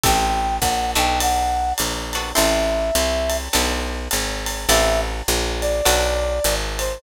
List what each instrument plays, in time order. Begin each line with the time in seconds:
0.03 electric bass (finger) A1, acoustic guitar (steel) C4 E4 G4 A4, brass section G5, kick, ride
0.61 electric bass (finger) A#1, brass section F#5, kick, hi-hat pedal, ride
0.95 electric bass (finger) B1, acoustic guitar (steel) B3 D4 F#4 A4, brass section G5, ride
1.20 brass section F#5, ride
1.78 electric bass (finger) A#1, hi-hat pedal, ride
2.13 acoustic guitar (steel) B3 D4 F#4 A4, ride
2.35 electric bass (finger) A1, acoustic guitar (steel) C4 E4 G4 A4, brass section E5, ride
2.95 electric bass (finger) C2, hi-hat pedal, ride
3.29 ride
3.53 electric bass (finger) B1, acoustic guitar (steel) B3 D4 F#4 A4, ride
4.11 electric bass (finger) G#1, hi-hat pedal, ride
4.46 ride
4.69 electric bass (finger) A1, acoustic guitar (steel) C4 E4 G4 A4, brass section E5, ride
5.28 electric bass (finger) A#1, hi-hat pedal, ride
5.61 brass section D5, ride
5.85 electric bass (finger) B1, acoustic guitar (steel) B3 D4 F#4 A4, ride
6.44 electric bass (finger) G#1, hi-hat pedal, ride
6.79 brass section C5, ride